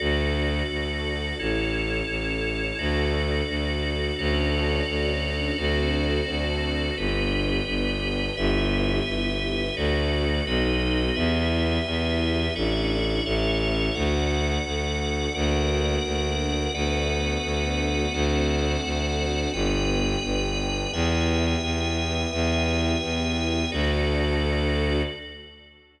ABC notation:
X:1
M:6/8
L:1/8
Q:3/8=86
K:D
V:1 name="String Ensemble 1"
[DFA]6 | [CEA]6 | [DFA]6 | [CDFA]6 |
[=CDFA]6 | [B,DG]6 | [B,EG]6 | [A,DF]3 [B,^DF]3 |
[B,EG]6 | [A,DE]3 [A,CE]3 | [A,DF]6 | [^A,DF]6 |
[A,B,DF]6 | [A,=CDF]6 | [B,DG]6 | [B,EG]6 |
[B,EG]6 | [DFA]6 |]
V:2 name="Drawbar Organ"
[FAd]6 | [EAc]6 | [FAd]6 | [FAcd]6 |
[FA=cd]6 | [GBd]6 | [GBe]6 | [FAd]3 [FB^d]3 |
[GBe]6 | [Ade]3 [Ace]3 | [Adf]6 | [^Adf]6 |
[ABdf]6 | [A=cdf]6 | [Bdg]6 | [Beg]6 |
[Beg]6 | [FAd]6 |]
V:3 name="Violin" clef=bass
D,,3 D,,3 | A,,,3 A,,,3 | D,,3 D,,3 | D,,3 D,,3 |
D,,3 D,,3 | G,,,3 G,,,3 | G,,,3 G,,,3 | D,,3 B,,,3 |
E,,3 E,,3 | A,,,3 A,,,3 | D,,3 D,,3 | D,,3 D,,3 |
D,,3 D,,3 | D,,3 D,,3 | G,,,3 G,,,3 | E,,3 E,,3 |
E,,3 E,,3 | D,,6 |]